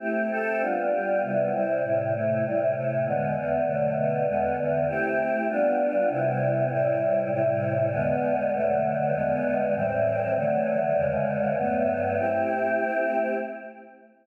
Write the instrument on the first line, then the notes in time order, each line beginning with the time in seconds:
choir aahs
0.00 A3 C4 E4 G4
0.31 A3 C4 G4 A4
0.61 G3 B3 D4 F4
0.91 G3 B3 F4 G4
1.22 C3 G3 B3 E4
1.52 C3 G3 C4 E4
1.83 A2 C3 G3 E4
2.13 A2 C3 A3 E4
2.44 A2 C3 G3 E4
2.74 A2 C3 A3 E4
3.05 E2 D3 G#3 B3
3.35 E2 D3 E3 B3
3.65 B2 D3 F#3 A3
3.96 B2 D3 A3 B3
4.26 E2 D3 G#3 B3
4.57 E2 D3 E3 B3
4.87 A3 C4 E4 G4
5.48 G3 B3 D4 F4
6.09 C3 G3 B3 E4
6.70 A2 C3 G3 E4
7.31 A2 C3 G3 E4
7.92 E2 D3 G#3 B3
8.53 B2 D3 F#3 A3
9.14 E2 D3 G#3 B3
9.74 A2 E3 G3 C4
10.36 D3 E3 F#3 A3
10.96 E2 C#3 D3 G#3
11.57 G2 F#3 A3 B3
12.18 A3 C4 E4 G4